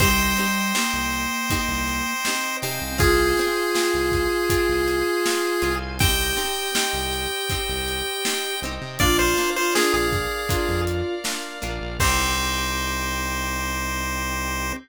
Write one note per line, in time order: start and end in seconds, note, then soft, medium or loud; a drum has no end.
0.00 0.33 C2 loud
0.00 0.72 G3 loud
0.00 0.35 C4 loud
0.00 0.35 D#4 loud
0.00 0.35 G4 loud
0.00 2.50 C5 medium
0.00 2.57 C5 loud
0.00 2.98 C5 medium
0.00 2.50 D#5 loud
0.00 2.98 D#5 medium
0.00 2.50 G5 medium
0.00 2.98 G5 loud
0.00 kick loud
0.00 closed hi-hat loud
0.37 0.73 C4 medium
0.37 0.73 D#4 loud
0.37 0.73 G4 medium
0.37 closed hi-hat medium
0.75 2.13 A#3 loud
0.75 1.44 C4 loud
0.75 1.44 D#4 medium
0.75 1.44 G4 medium
0.75 snare loud
0.93 1.27 C2 medium
1.12 closed hi-hat medium
1.50 2.19 C4 loud
1.50 2.19 D#4 loud
1.50 2.19 G4 loud
1.50 kick loud
1.50 closed hi-hat loud
1.68 2.02 C2 medium
1.88 closed hi-hat medium
2.25 2.60 C4 medium
2.25 2.91 C4 loud
2.25 2.60 D#4 medium
2.25 2.60 G4 loud
2.25 snare loud
2.62 2.79 C3 medium
2.62 2.97 C4 medium
2.62 2.97 D#4 loud
2.62 2.97 G4 loud
2.62 5.94 C5 medium
2.62 5.94 F5 medium
2.62 5.94 G#5 medium
2.62 closed hi-hat medium
2.82 2.98 C2 medium
2.98 3.34 C2 loud
2.98 3.33 C4 loud
2.98 3.33 F4 loud
2.98 5.71 F4 loud
2.98 3.33 G#4 loud
2.98 5.76 G#4 loud
2.98 5.96 C5 loud
2.98 5.96 F5 medium
2.98 5.96 G#5 medium
2.98 kick loud
2.98 closed hi-hat loud
3.37 3.74 C4 loud
3.37 3.74 F4 medium
3.37 3.74 G#4 medium
3.37 closed hi-hat medium
3.75 4.44 C4 loud
3.75 4.44 F4 medium
3.75 4.44 G#4 medium
3.75 snare loud
3.94 4.28 C2 medium
4.12 kick medium
4.12 closed hi-hat medium
4.50 5.19 C4 medium
4.50 5.19 F4 loud
4.50 5.19 G#4 medium
4.50 kick loud
4.50 closed hi-hat loud
4.69 5.03 C2 medium
4.88 closed hi-hat medium
5.26 5.60 C4 medium
5.26 5.60 F4 medium
5.26 5.60 G#4 loud
5.26 snare loud
5.62 6.34 C2 medium
5.62 5.97 C4 loud
5.62 5.97 F4 medium
5.62 5.97 G#4 medium
5.62 closed hi-hat medium
5.99 6.35 C4 loud
5.99 6.35 D#4 loud
5.99 8.55 G4 loud
5.99 6.35 G4 loud
5.99 8.97 C5 medium
5.99 8.94 C5 medium
5.99 8.97 D#5 medium
5.99 8.94 D#5 medium
5.99 8.97 G5 medium
5.99 8.60 G5 loud
5.99 8.94 G5 medium
5.99 kick loud
5.99 closed hi-hat loud
6.37 6.71 C4 loud
6.37 6.71 D#4 loud
6.37 6.71 G4 medium
6.37 closed hi-hat medium
6.75 7.44 C4 loud
6.75 7.44 D#4 medium
6.75 7.44 G4 loud
6.75 snare loud
6.93 7.27 C2 medium
7.13 closed hi-hat medium
7.50 8.20 C4 medium
7.50 8.20 D#4 medium
7.50 8.20 G4 loud
7.50 kick medium
7.50 closed hi-hat loud
7.69 8.02 C2 medium
7.88 closed hi-hat medium
8.25 8.60 C4 loud
8.25 8.60 D#4 loud
8.25 8.60 G4 medium
8.25 snare loud
8.62 8.79 C2 medium
8.62 8.98 C4 loud
8.62 8.98 D#4 medium
8.62 8.98 G4 loud
8.62 closed hi-hat medium
8.81 8.98 C3 medium
8.99 9.34 A#1 medium
8.99 9.34 A#3 loud
8.99 9.34 D4 loud
8.99 9.34 F4 loud
8.99 9.51 F4 loud
8.99 11.97 A#4 medium
8.99 11.95 A#4 medium
8.99 9.18 D5 loud
8.99 11.97 D5 medium
8.99 11.95 D5 medium
8.99 11.97 F5 medium
8.99 11.95 F5 loud
8.99 kick loud
8.99 closed hi-hat loud
9.19 9.50 C5 medium
9.37 9.72 A#3 loud
9.37 9.72 D4 medium
9.37 9.72 F4 medium
9.37 closed hi-hat medium
9.56 10.07 F4 loud
9.56 9.74 C5 medium
9.75 10.44 A#3 loud
9.75 10.44 D4 loud
9.75 10.44 F4 medium
9.75 9.93 G#4 loud
9.75 snare loud
9.93 10.27 A#1 medium
9.93 10.81 G#4 medium
10.12 kick loud
10.12 closed hi-hat medium
10.49 11.18 A#3 medium
10.49 11.18 D4 medium
10.49 11.15 F4 loud
10.49 11.18 F4 medium
10.49 kick loud
10.49 closed hi-hat loud
10.69 11.02 F2 medium
10.87 closed hi-hat loud
11.24 11.59 A#3 medium
11.24 11.59 D4 medium
11.24 11.59 F4 medium
11.24 snare loud
11.62 11.79 A#1 medium
11.62 11.96 A#3 medium
11.62 11.96 D4 loud
11.62 11.96 F4 loud
11.62 closed hi-hat medium
11.81 11.98 A#1 medium
12.00 14.73 C2 loud
12.00 14.72 C4 loud
12.00 14.73 C4 loud
12.00 14.73 C4 medium
12.00 14.73 D#4 loud
12.00 14.72 D#4 medium
12.00 14.73 D#4 loud
12.00 14.73 G4 loud
12.00 14.73 G4 medium
12.00 14.72 G4 loud
12.00 14.73 C5 loud
12.00 kick loud
12.00 crash loud